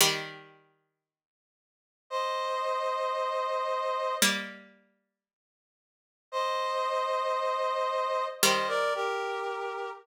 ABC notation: X:1
M:4/4
L:1/16
Q:1/4=57
K:Eblyd
V:1 name="Brass Section"
z8 [ce]8 | z8 [ce]8 | [ce] [Bd] [GB]4 z10 |]
V:2 name="Harpsichord"
[E,G,]12 z4 | [G,B,]12 z4 | [E,G,]6 z10 |]